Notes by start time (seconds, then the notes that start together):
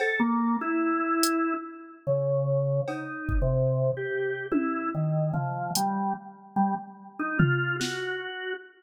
0.00 A4, cowbell
0.20 A#3
0.61 E4
1.23 closed hi-hat
2.07 C#3
2.88 D#4, cowbell
3.29 kick
3.42 C3
3.97 G4
4.52 E4, high tom
4.95 D#3
5.33 F3, floor tom
5.75 G3, closed hi-hat
6.56 G3
7.19 D#4
7.39 F4, floor tom
7.79 F#4, snare